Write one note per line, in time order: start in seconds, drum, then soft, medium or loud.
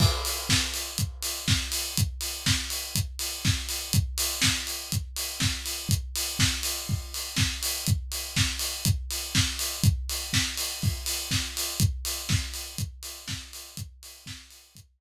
0.00 kick loud
0.00 crash loud
0.25 open hi-hat medium
0.49 kick medium
0.49 snare loud
0.74 open hi-hat medium
0.98 kick medium
0.98 closed hi-hat medium
1.23 open hi-hat medium
1.48 kick medium
1.48 snare loud
1.72 open hi-hat medium
1.97 kick medium
1.97 closed hi-hat loud
2.21 open hi-hat medium
2.46 kick medium
2.46 snare loud
2.70 open hi-hat medium
2.95 kick medium
2.95 closed hi-hat medium
3.19 open hi-hat medium
3.45 kick medium
3.45 snare medium
3.69 open hi-hat medium
3.93 kick medium
3.93 closed hi-hat loud
4.18 open hi-hat medium
4.42 kick medium
4.42 snare loud
4.67 open hi-hat medium
4.92 kick medium
4.92 closed hi-hat medium
5.16 open hi-hat medium
5.40 kick medium
5.40 snare medium
5.66 open hi-hat medium
5.89 kick medium
5.89 closed hi-hat medium
6.16 open hi-hat medium
6.39 kick medium
6.39 snare loud
6.63 open hi-hat medium
6.89 kick medium
7.14 open hi-hat medium
7.36 kick medium
7.36 snare loud
7.63 open hi-hat medium
7.87 kick medium
7.87 closed hi-hat medium
8.12 open hi-hat medium
8.36 kick medium
8.36 snare loud
8.59 open hi-hat medium
8.85 kick medium
8.85 closed hi-hat loud
9.11 open hi-hat medium
9.35 kick medium
9.35 snare loud
9.59 open hi-hat medium
9.84 kick loud
9.84 closed hi-hat medium
10.09 open hi-hat medium
10.33 kick medium
10.33 snare loud
10.57 open hi-hat medium
10.82 kick medium
10.82 open hi-hat medium
11.06 open hi-hat medium
11.31 kick medium
11.31 snare medium
11.57 open hi-hat medium
11.80 kick loud
11.80 closed hi-hat medium
12.05 open hi-hat medium
12.29 kick loud
12.29 snare medium
12.54 open hi-hat medium
12.78 kick medium
12.78 closed hi-hat medium
13.03 open hi-hat medium
13.28 kick medium
13.28 snare medium
13.53 open hi-hat medium
13.77 kick medium
13.77 closed hi-hat loud
14.03 open hi-hat medium
14.26 kick medium
14.26 snare loud
14.51 open hi-hat medium
14.75 kick medium
14.75 closed hi-hat loud